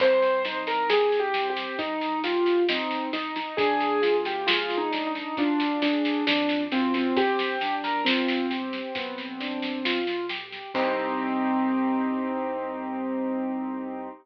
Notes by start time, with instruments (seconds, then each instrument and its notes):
0.00 acoustic grand piano C2 C4 C5, kick, snare, crash
0.22 snare
0.45 acoustic grand piano D#4, snare
0.67 acoustic grand piano A#4, snare
0.90 acoustic grand piano G4 G#4, snare
1.12 snare
1.20 acoustic grand piano G4
1.34 acoustic grand piano C4, snare
1.50 acoustic grand piano G4
1.56 snare
1.78 acoustic grand piano C2 D#4, kick, snare
2.01 snare
2.23 acoustic grand piano F4 G4, snare
2.46 snare
2.69 acoustic grand piano C4 D#4, snare
2.91 snare
3.13 acoustic grand piano D#4, snare
3.36 acoustic grand piano D#4, snare
3.57 acoustic grand piano D2 D4 G#4, kick, snare
3.80 snare
4.02 acoustic grand piano F4, snare
4.25 acoustic grand piano G4, snare
4.47 acoustic grand piano F4 G#4, snare
4.70 snare
4.78 acoustic grand piano D#4
4.91 acoustic grand piano D4, snare
5.07 acoustic grand piano D#4
5.15 snare
5.37 acoustic grand piano D2 D4 F4, kick, snare
5.60 snare
5.81 acoustic grand piano D4 G#4, snare
6.05 snare
6.26 acoustic grand piano F2 D4, snare
6.49 snare
6.72 acoustic grand piano F#2 C4 F4, snare
6.94 acoustic grand piano C4, snare
7.16 acoustic grand piano G1 C4 G4, kick, snare
7.39 snare
7.61 acoustic grand piano D4, snare
7.84 acoustic grand piano A#4, snare
8.05 acoustic grand piano C4 F4, snare
8.28 snare
8.50 acoustic grand piano G4, snare
8.73 snare
8.95 acoustic grand piano B1 B3, kick, snare
9.18 snare
9.40 acoustic grand piano D4, snare
9.62 snare
9.85 acoustic grand piano F4, snare
10.07 snare
10.29 acoustic grand piano G4, snare
10.52 snare
10.74 acoustic grand piano C2 C4 D#4 G4, kick, crash